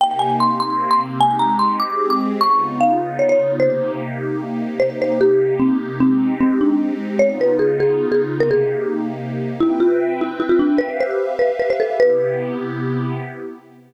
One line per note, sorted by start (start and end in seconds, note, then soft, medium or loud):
0.00 0.59 C3 medium
0.00 0.59 A#3 medium
0.00 0.59 D#4 medium
0.00 0.59 G4 medium
0.00 0.20 G5 medium
0.19 0.36 G#5 medium
0.40 0.60 C6 medium
0.60 1.20 C3 medium
0.60 1.20 A#3 medium
0.60 1.19 C4 medium
0.60 1.19 G4 medium
0.60 0.89 C6 medium
0.91 1.00 C6 medium
1.20 1.79 G#3 medium
1.20 1.79 C4 medium
1.20 1.79 D#4 medium
1.20 1.79 G4 medium
1.20 1.37 G#5 medium
1.39 1.57 A#5 medium
1.59 1.77 C6 medium
1.80 2.40 G#3 medium
1.80 2.40 C4 medium
1.80 2.40 G4 medium
1.80 2.40 G#4 medium
1.80 2.05 D6 medium
2.10 2.20 D6 medium
2.40 3.59 C#3 medium
2.40 3.59 B3 medium
2.40 3.59 D#4 medium
2.40 3.59 F4 medium
2.40 2.76 C#6 medium
2.81 3.18 F5 medium
3.19 3.29 C#5 medium
3.29 3.53 C#5 medium
3.60 4.79 C3 medium
3.60 4.79 A#3 medium
3.60 4.79 D#4 medium
3.60 4.79 G4 medium
3.60 3.92 C5 medium
4.80 5.99 C3 medium
4.80 5.99 A#3 medium
4.80 5.99 D#4 medium
4.80 5.99 G4 medium
4.80 4.97 C5 medium
5.02 5.19 C5 medium
5.21 5.54 G4 medium
5.60 5.77 C4 medium
6.00 7.19 G#3 medium
6.00 7.19 C4 medium
6.00 6.34 C4 medium
6.00 7.19 D#4 medium
6.00 7.19 G4 medium
6.41 6.59 C4 medium
6.61 6.94 D4 medium
7.19 8.39 C#3 medium
7.19 8.39 B3 medium
7.19 8.39 D#4 medium
7.19 8.39 F4 medium
7.19 7.37 C#5 medium
7.41 7.57 B4 medium
7.59 7.77 G#4 medium
7.80 8.06 G#4 medium
8.12 8.21 G#4 medium
8.40 9.59 C3 medium
8.40 9.59 A#3 medium
8.40 9.59 D#4 medium
8.40 9.59 G4 medium
8.40 8.50 A#4 medium
8.51 8.96 G#4 medium
9.60 10.79 C4 medium
9.60 9.77 E4 medium
9.60 10.79 B4 medium
9.60 10.79 E5 medium
9.60 10.79 G5 medium
9.80 10.13 F4 medium
10.21 10.38 E4 medium
10.40 10.49 E4 medium
10.49 10.59 F4 medium
10.59 10.79 D4 medium
10.78 11.99 G4 medium
10.78 10.97 B4 medium
10.78 11.99 B4 medium
10.78 11.99 E5 medium
10.78 11.99 F5 medium
11.00 11.33 C5 medium
11.39 11.57 B4 medium
11.60 11.69 B4 medium
11.70 11.80 C5 medium
11.80 11.96 A4 medium
12.00 13.19 C3 medium
12.00 13.19 B3 medium
12.00 13.19 E4 medium
12.00 13.19 G4 medium
12.00 12.54 B4 medium